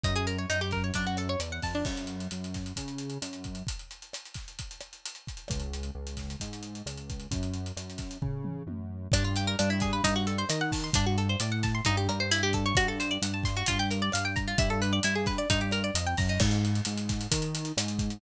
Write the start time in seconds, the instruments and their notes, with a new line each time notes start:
0.04 synth bass 1 F#2, acoustic guitar (steel) D#4, kick, closed hi-hat
0.16 acoustic guitar (steel) G#4
0.27 acoustic guitar (steel) A#4, closed hi-hat
0.38 acoustic guitar (steel) C#5
0.50 synth bass 1 F#2, acoustic guitar (steel) D#4, closed hi-hat
0.61 acoustic guitar (steel) G4
0.71 acoustic guitar (steel) A#4, kick, snare, closed hi-hat
0.84 acoustic guitar (steel) C#5
0.94 synth bass 1 F#2, acoustic guitar (steel) D4, kick, closed hi-hat
1.07 acoustic guitar (steel) F#4
1.17 acoustic guitar (steel) A4, cross-stick, closed hi-hat
1.29 acoustic guitar (steel) C#5
1.39 synth bass 1 E2, acoustic guitar (steel) D5, closed hi-hat
1.52 acoustic guitar (steel) F#5
1.62 synth bass 1 F2, acoustic guitar (steel) A5, kick, open hi-hat
1.75 acoustic guitar (steel) D4
1.85 synth bass 1 F#2, kick, cross-stick, crash
1.97 closed hi-hat
2.07 closed hi-hat
2.20 closed hi-hat
2.31 synth bass 1 F#2, closed hi-hat
2.44 closed hi-hat
2.54 kick, snare, closed hi-hat
2.66 closed hi-hat
2.76 synth bass 1 C#3, kick, closed hi-hat
2.88 closed hi-hat
2.98 closed hi-hat
3.10 closed hi-hat
3.22 synth bass 1 F#2, cross-stick, closed hi-hat
3.33 closed hi-hat
3.44 kick, closed hi-hat
3.55 closed hi-hat
3.67 kick, closed hi-hat
3.79 closed hi-hat
3.91 closed hi-hat
4.02 closed hi-hat
4.13 cross-stick, closed hi-hat
4.25 closed hi-hat
4.34 kick, snare, closed hi-hat
4.48 closed hi-hat
4.59 kick, closed hi-hat
4.71 closed hi-hat
4.80 cross-stick, closed hi-hat
4.93 closed hi-hat
5.05 closed hi-hat
5.15 closed hi-hat
5.27 kick, closed hi-hat
5.37 closed hi-hat
5.48 synth bass 1 C#2, kick, cross-stick, closed hi-hat
5.60 closed hi-hat
5.73 closed hi-hat
5.83 closed hi-hat
5.95 synth bass 1 C#2
6.07 closed hi-hat
6.17 kick, snare, closed hi-hat
6.30 closed hi-hat
6.40 synth bass 1 G#2, kick, closed hi-hat
6.53 closed hi-hat
6.63 closed hi-hat
6.75 closed hi-hat
6.86 synth bass 1 C#2, cross-stick, closed hi-hat
6.97 closed hi-hat
7.10 kick, closed hi-hat
7.20 closed hi-hat
7.31 synth bass 1 F#2, kick, closed hi-hat
7.43 closed hi-hat
7.54 closed hi-hat
7.66 closed hi-hat
7.77 synth bass 1 F#2, cross-stick, closed hi-hat
7.90 closed hi-hat
7.98 kick, snare, closed hi-hat
8.11 closed hi-hat
8.22 synth bass 1 C#3, kick, floor tom
8.44 mid tom
8.67 synth bass 1 F#2, high tom
9.12 synth bass 1 G2, acoustic guitar (steel) D4, kick, cross-stick, closed hi-hat
9.24 acoustic guitar (steel) F4
9.36 acoustic guitar (steel) G4, closed hi-hat
9.47 acoustic guitar (steel) A#4
9.59 synth bass 1 G2, acoustic guitar (steel) D4, closed hi-hat
9.70 acoustic guitar (steel) E4
9.80 acoustic guitar (steel) G#4, kick, snare, closed hi-hat
9.93 acoustic guitar (steel) B4
10.04 synth bass 1 G2, acoustic guitar (steel) D#4, kick, closed hi-hat
10.16 acoustic guitar (steel) F#4
10.27 acoustic guitar (steel) A4, closed hi-hat
10.38 acoustic guitar (steel) C5
10.49 synth bass 1 D#3, acoustic guitar (steel) D#5, cross-stick, closed hi-hat
10.61 acoustic guitar (steel) F#5
10.72 acoustic guitar (steel) A5, kick, open hi-hat
10.84 acoustic guitar (steel) C6
10.93 synth bass 1 G2, acoustic guitar (steel) D4, kick, closed hi-hat
11.06 acoustic guitar (steel) F#4
11.18 acoustic guitar (steel) A4, closed hi-hat
11.29 acoustic guitar (steel) C5
11.40 synth bass 1 A2, acoustic guitar (steel) D5, cross-stick, closed hi-hat
11.52 acoustic guitar (steel) F#5
11.63 acoustic guitar (steel) A5, kick, snare, closed hi-hat
11.75 acoustic guitar (steel) C6
11.85 synth bass 1 G2, acoustic guitar (steel) D#4, kick, closed hi-hat
11.97 acoustic guitar (steel) G4
12.09 synth bass 1 G2, acoustic guitar (steel) A#4, cross-stick, closed hi-hat
12.20 acoustic guitar (steel) C5
12.31 acoustic guitar (steel) E4, closed hi-hat
12.43 acoustic guitar (steel) G4
12.53 acoustic guitar (steel) A4, kick, closed hi-hat
12.66 acoustic guitar (steel) C#5
12.75 synth bass 1 G2, acoustic guitar (steel) F#4, kick, cross-stick, closed hi-hat
12.88 acoustic guitar (steel) A4
13.00 acoustic guitar (steel) C5, closed hi-hat
13.11 acoustic guitar (steel) D5
13.22 synth bass 1 G2, acoustic guitar (steel) F#5, closed hi-hat
13.34 acoustic guitar (steel) A5
13.43 acoustic guitar (steel) C6, kick, snare, closed hi-hat
13.57 acoustic guitar (steel) F#4
13.66 synth bass 1 G2, acoustic guitar (steel) F4, kick, closed hi-hat
13.79 acoustic guitar (steel) G4
13.91 acoustic guitar (steel) A#4, closed hi-hat
14.02 acoustic guitar (steel) D5
14.12 synth bass 1 G2, acoustic guitar (steel) F5, cross-stick, closed hi-hat
14.25 acoustic guitar (steel) G5
14.36 acoustic guitar (steel) A#5, kick, closed hi-hat
14.48 acoustic guitar (steel) F4
14.58 synth bass 1 G2, acoustic guitar (steel) E4, kick, closed hi-hat
14.70 acoustic guitar (steel) A4
14.82 acoustic guitar (steel) B4, closed hi-hat
14.93 acoustic guitar (steel) D5
15.03 synth bass 1 G2, acoustic guitar (steel) E4, closed hi-hat
15.15 acoustic guitar (steel) G#4
15.26 acoustic guitar (steel) B4, kick, snare, closed hi-hat
15.38 acoustic guitar (steel) D5
15.50 synth bass 1 G2, acoustic guitar (steel) D#4, kick, closed hi-hat
15.61 acoustic guitar (steel) G4
15.71 acoustic guitar (steel) A#4, cross-stick, closed hi-hat
15.84 acoustic guitar (steel) D5
15.94 synth bass 1 F2, acoustic guitar (steel) D#5, closed hi-hat
16.07 acoustic guitar (steel) G5
16.17 synth bass 1 F#2, acoustic guitar (steel) A#5, kick, open hi-hat
16.29 acoustic guitar (steel) D#4
16.40 synth bass 1 G#2, kick, cross-stick, crash
16.51 closed hi-hat
16.65 closed hi-hat
16.75 closed hi-hat
16.85 synth bass 1 G#2, closed hi-hat
16.97 closed hi-hat
17.09 kick, snare, closed hi-hat
17.21 closed hi-hat
17.31 synth bass 1 D#3, kick, closed hi-hat
17.42 closed hi-hat
17.55 closed hi-hat
17.65 closed hi-hat
17.77 synth bass 1 G#2, cross-stick, closed hi-hat
17.88 closed hi-hat
17.99 kick, closed hi-hat
18.10 closed hi-hat